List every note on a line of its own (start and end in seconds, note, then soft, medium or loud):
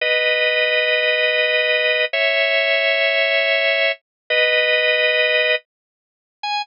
0.01 2.05 B4 medium
0.01 2.05 D#5 loud
2.13 3.92 C#5 medium
2.13 3.92 E5 loud
4.30 5.55 B4 loud
4.30 5.55 D#5 loud
6.43 6.62 G#5 loud